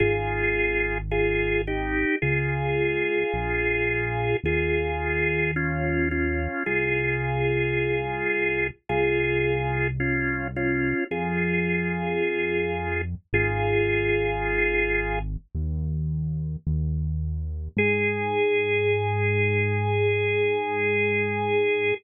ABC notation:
X:1
M:4/4
L:1/8
Q:1/4=54
K:Ab
V:1 name="Drawbar Organ"
[FA]2 [FA] [EG] [FA]4 | [FA]2 [DF] [DF] [FA]4 | [FA]2 [DF] [DF] [FA]4 | [FA]4 z4 |
A8 |]
V:2 name="Synth Bass 1" clef=bass
A,,,4 D,,2 B,,,2 | E,,4 C,,4 | C,,4 F,,4 | A,,,4 E,,2 E,,2 |
A,,8 |]